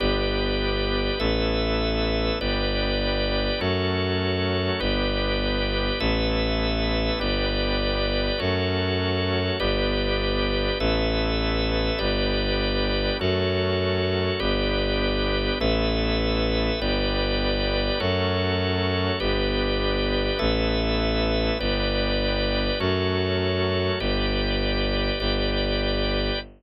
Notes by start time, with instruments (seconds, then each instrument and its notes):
0.00 violin G1, drawbar organ B3 D4 G4 B4 D5
1.20 violin A1, drawbar organ A3 B3 E4 A4 B4 E5
2.40 violin G1, drawbar organ G3 B3 D4 G4 B4 D5
3.60 violin F#2, drawbar organ F#3 A3 C#4 F#4 A4 C#5
4.80 violin G1, drawbar organ B3 D4 G4 B4 D5
6.00 violin A1, drawbar organ A3 B3 E4 A4 B4 E5
7.19 violin G1, drawbar organ G3 B3 D4 G4 B4 D5
8.38 violin F#2, drawbar organ F#3 A3 C#4 F#4 A4 C#5
9.60 violin G1, drawbar organ B3 D4 G4 B4 D5
10.80 violin A1, drawbar organ A3 B3 E4 A4 B4 E5
11.99 violin G1, drawbar organ G3 B3 D4 G4 B4 D5
13.20 violin F#2, drawbar organ F#3 A3 C#4 F#4 A4 C#5
14.40 violin G1, drawbar organ B3 D4 G4 B4 D5
15.60 violin A1, drawbar organ A3 B3 E4 A4 B4 E5
16.80 violin G1, drawbar organ G3 B3 D4 G4 B4 D5
18.00 violin F#2, drawbar organ F#3 A3 C#4 F#4 A4 C#5
19.20 violin G1, drawbar organ B3 D4 G4 B4 D5
20.39 violin A1, drawbar organ A3 B3 E4 A4 B4 E5
21.59 violin G1, drawbar organ G3 B3 D4 G4 B4 D5
22.80 violin F#2, drawbar organ F#3 A3 C#4 F#4 A4 C#5
24.00 violin G1, drawbar organ G4 B4 D5
25.20 violin G1, drawbar organ G4 B4 D5